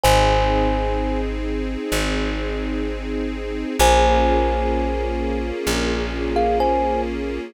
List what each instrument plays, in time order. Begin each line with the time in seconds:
0.04 electric bass (finger) G#1, string ensemble 1 C4 D#4 G#4, kalimba C5 G#5
1.92 electric bass (finger) G#1
3.79 electric bass (finger) A#1, string ensemble 1 A#3 C#4 F4 G#4, kalimba C5 G#5
5.67 electric bass (finger) A#1
6.36 kalimba G#4 F5
6.60 kalimba C5 G#5